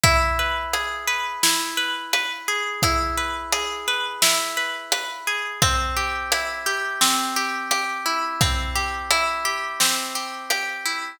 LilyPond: <<
  \new Staff \with { instrumentName = "Orchestral Harp" } { \time 4/4 \key e \major \tempo 4 = 86 e'8 b'8 gis'8 b'8 e'8 b'8 b'8 gis'8 | e'8 b'8 gis'8 b'8 e'8 b'8 b'8 gis'8 | c'8 g'8 e'8 g'8 c'8 g'8 g'8 e'8 | c'8 g'8 e'8 g'8 c'8 g'8 g'8 e'8 | }
  \new DrumStaff \with { instrumentName = "Drums" } \drummode { \time 4/4 <hh bd>4 hh4 sn4 hh4 | <hh bd>4 hh4 sn4 hh4 | <hh bd>4 hh4 sn4 hh4 | <hh bd>4 hh4 sn4 hh4 | }
>>